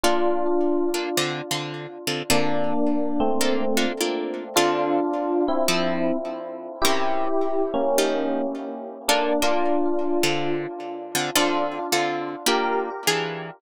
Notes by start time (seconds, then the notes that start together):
0.03 A#3 D4 F4 A4
0.94 A#3 D4 F4 A4
1.17 D3 C4 F4 A4
1.51 D3 C4 F4 A4
2.07 D3 C4 F4 A4
2.30 D3 A#3 C4 D4 F4 A4
3.20 A3 C4
3.41 A#3 D4 F4 A4
3.77 A#3 D4 F4 A4
4.00 A#3 D4 F4 A4
4.56 D3 C4 D4 F4 A4
5.48 C4 E4
5.68 F3 C4 E4 A4
6.82 C3 C#4 E4 G4 A#4
7.74 A#3 C#4
7.98 F3 D#4 G4 A4
9.08 A#3 D4 F4 A4
9.42 A#3 D4 F4 A4
10.23 D3 C4 F4 A4
11.15 D3 C4 F4 A4
11.35 D3 C4 D4 F4 A4
11.92 D3 C4 F4 A4
12.46 A#3 D4 F4 G4 A#4
13.07 E3 D4 F4 G#4